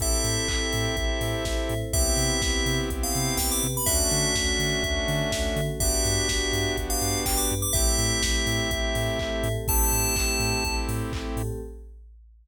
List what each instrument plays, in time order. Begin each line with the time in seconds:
0.00 synth bass 2 A1, pad 5 (bowed) C4 E4 G4 A4, lead 2 (sawtooth) C4 E4 G4 A4, tubular bells E5, kick, closed hi-hat
0.24 synth bass 2 A2, open hi-hat
0.48 synth bass 2 A1, kick, clap
0.73 synth bass 2 A2, open hi-hat
0.97 synth bass 2 A1, pad 5 (bowed) C4 E4 A4 C5, kick, closed hi-hat
1.21 synth bass 2 A2, open hi-hat
1.45 synth bass 2 A1, kick, snare
1.69 synth bass 2 A2, open hi-hat
1.93 synth bass 2 C2, lead 2 (sawtooth) B3 C4 E4 G4, pad 5 (bowed) B3 C4 E4 G4, tubular bells E5, kick, closed hi-hat
2.17 synth bass 2 C3, open hi-hat
2.42 synth bass 2 C2, kick, snare
2.66 synth bass 2 C3, open hi-hat
2.90 synth bass 2 C2, pad 5 (bowed) B3 C4 G4 B4, kick, closed hi-hat
3.03 tubular bells F5
3.15 synth bass 2 C3, open hi-hat
3.37 synth bass 2 C2, tubular bells G5, kick, snare
3.52 tubular bells D6
3.63 synth bass 2 C3, open hi-hat
3.77 tubular bells B5
3.86 synth bass 2 D2, lead 2 (sawtooth) A3 C#4 D4 F#4, pad 5 (bowed) A3 C#4 D4 F#4, tubular bells E5, kick, closed hi-hat
4.11 synth bass 2 D3, open hi-hat
4.35 synth bass 2 D2, kick, snare
4.59 synth bass 2 D3, open hi-hat
4.83 synth bass 2 D2, pad 5 (bowed) A3 C#4 F#4 A4, kick, closed hi-hat
5.08 synth bass 2 D3, open hi-hat
5.32 synth bass 2 D2, kick, snare
5.56 synth bass 2 D3, open hi-hat
5.80 synth bass 2 G1, lead 2 (sawtooth) B3 D4 F#4 G4, pad 5 (bowed) B3 D4 F#4 G4, tubular bells E5, kick, closed hi-hat
6.05 synth bass 2 G2, open hi-hat
6.29 synth bass 2 G1, kick, snare
6.53 synth bass 2 G2, open hi-hat
6.77 synth bass 2 G1, pad 5 (bowed) B3 D4 G4 B4, kick, closed hi-hat
6.90 tubular bells F5
7.01 synth bass 2 G2, open hi-hat
7.25 synth bass 2 G1, tubular bells G5, kick, clap
7.37 tubular bells D6
7.50 synth bass 2 G2, open hi-hat
7.62 tubular bells D6
7.73 synth bass 2 A1, pad 5 (bowed) A3 C4 E4 G4, lead 2 (sawtooth) A3 C4 E4 G4, tubular bells E5, kick, closed hi-hat
7.98 synth bass 2 A2, open hi-hat
8.23 synth bass 2 A1, kick, snare
8.46 synth bass 2 A2, open hi-hat
8.71 synth bass 2 A1, pad 5 (bowed) A3 C4 G4 A4, kick, closed hi-hat
8.95 synth bass 2 A2, open hi-hat
9.19 synth bass 2 A1, kick, clap
9.43 synth bass 2 A2, open hi-hat
9.68 synth bass 2 A1, pad 5 (bowed) A3 C4 E4 G4, lead 2 (sawtooth) A3 C4 E4 G4, tubular bells A5, kick, closed hi-hat
9.92 synth bass 2 A2, open hi-hat
10.16 synth bass 2 A1, kick, clap
10.40 synth bass 2 A2, open hi-hat
10.65 synth bass 2 A1, pad 5 (bowed) A3 C4 G4 A4, kick, closed hi-hat
10.88 synth bass 2 A2, open hi-hat
11.12 synth bass 2 A1, kick, clap
11.36 synth bass 2 A2, open hi-hat